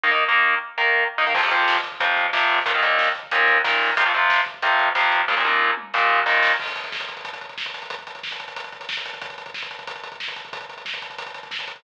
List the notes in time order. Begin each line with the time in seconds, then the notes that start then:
0.03 D#3 A#3 D#4
0.11 D#3 A#3 D#4
0.29 D#3 A#3 D#4
0.78 D#3 A#3 D#4
1.18 D#3 A#3 D#4
1.27 D#3 A#3 D#4
1.34 F2 C3 F3, kick, crash
1.43 F2 C3 F3, kick
1.51 F2 C3 F3, kick, closed hi-hat
1.59 kick
1.68 kick, snare
1.76 kick
1.84 kick, closed hi-hat
1.92 kick
2.00 F2 C3 F3, kick, closed hi-hat
2.08 kick
2.17 kick, closed hi-hat
2.25 kick
2.33 F2 C3 F3, kick, snare
2.41 kick
2.49 kick, open hi-hat
2.58 kick
2.66 D#2 A#2 D#3, kick, closed hi-hat
2.74 D#2 A#2 D#3, kick
2.82 D#2 A#2 D#3, kick, closed hi-hat
2.91 kick
2.99 kick, snare
3.07 kick
3.15 kick, closed hi-hat
3.23 kick
3.31 D#2 A#2 D#3, kick, closed hi-hat
3.40 kick
3.48 kick, closed hi-hat
3.56 kick
3.64 D#2 A#2 D#3, kick, snare
3.73 kick
3.81 kick, open hi-hat
3.89 kick
3.97 F2 C3 F3, kick, closed hi-hat
4.05 F2 C3 F3, kick
4.14 F2 C3 F3, kick, closed hi-hat
4.22 kick
4.30 kick, snare
4.38 kick
4.46 kick, closed hi-hat
4.54 kick
4.62 F2 C3 F3, kick, closed hi-hat
4.71 kick
4.79 kick, closed hi-hat
4.87 kick
4.95 F2 C3 F3, kick, snare
5.03 kick
5.12 kick, closed hi-hat
5.20 kick
5.28 D#2 A#2 D#3, kick, snare
5.37 D#2 A#2 D#3
5.45 D#2 A#2 D#3, high tom
5.77 mid tom
5.94 D#2 A#2 D#3, snare
6.10 floor tom
6.26 D#2 A#2 D#3, snare
6.43 snare
6.59 kick, crash
6.67 kick, closed hi-hat
6.76 kick, closed hi-hat
6.84 kick, closed hi-hat
6.92 kick, snare
7.00 kick, closed hi-hat
7.08 kick, closed hi-hat
7.17 kick, closed hi-hat
7.25 kick, closed hi-hat
7.33 kick, closed hi-hat
7.41 kick, closed hi-hat
7.49 kick, closed hi-hat
7.58 kick, snare
7.66 kick, closed hi-hat
7.74 kick, snare, closed hi-hat
7.82 kick, closed hi-hat
7.90 kick, closed hi-hat
7.99 kick, closed hi-hat
8.07 kick, closed hi-hat
8.15 kick, closed hi-hat
8.23 kick, snare
8.31 kick, closed hi-hat
8.40 kick, closed hi-hat
8.48 kick, closed hi-hat
8.56 kick, closed hi-hat
8.64 kick, closed hi-hat
8.72 kick, closed hi-hat
8.80 kick, closed hi-hat
8.89 kick, snare
8.97 kick, closed hi-hat
9.05 kick, snare, closed hi-hat
9.14 kick, closed hi-hat
9.22 kick, closed hi-hat
9.30 kick, closed hi-hat
9.38 kick, closed hi-hat
9.46 kick, closed hi-hat
9.54 kick, snare
9.63 kick, closed hi-hat
9.71 kick, closed hi-hat
9.79 kick, closed hi-hat
9.87 kick, closed hi-hat
9.96 kick, closed hi-hat
10.04 kick, closed hi-hat
10.12 kick, closed hi-hat
10.20 kick, snare
10.28 kick, closed hi-hat
10.36 kick, snare, closed hi-hat
10.45 kick, closed hi-hat
10.53 kick, closed hi-hat
10.61 kick, closed hi-hat
10.69 kick, closed hi-hat
10.77 kick, closed hi-hat
10.85 kick, snare
10.94 kick, closed hi-hat
11.02 kick, closed hi-hat
11.10 kick, closed hi-hat
11.18 kick, closed hi-hat
11.26 kick, closed hi-hat
11.34 kick, closed hi-hat
11.43 kick, closed hi-hat
11.51 kick, snare
11.59 kick, closed hi-hat
11.67 kick, snare, closed hi-hat
11.76 kick, closed hi-hat